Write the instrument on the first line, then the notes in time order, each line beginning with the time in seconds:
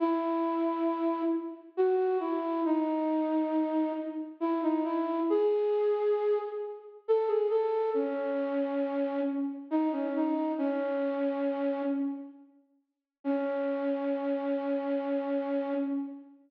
flute
0.00 E4
1.77 F#4
1.97 F#4
2.20 E4
2.65 D#4
4.40 E4
4.63 D#4
4.84 E4
5.30 G#4
7.08 A4
7.28 G#4
7.50 A4
7.94 C#4
9.71 D#4
9.92 C#4
10.16 D#4
10.58 C#4
13.24 C#4